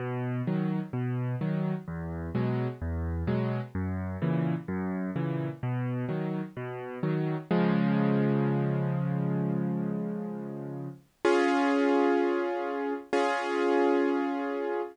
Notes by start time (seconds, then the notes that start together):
0.00 B2
0.47 D#3 F#3
0.93 B2
1.41 D#3 F#3
1.88 E2
2.35 B2 F#3 G#3
2.82 E2
3.27 B2 F#3 G#3
3.75 F#2
4.22 A#2 C#3 E3
4.68 F#2
5.16 A#2 C#3 E3
5.63 B2
6.09 D#3 F#3
6.57 B2
7.03 D#3 F#3
7.51 C#3 F3 G#3
11.25 C#4 F4 G#4
13.13 C#4 F4 G#4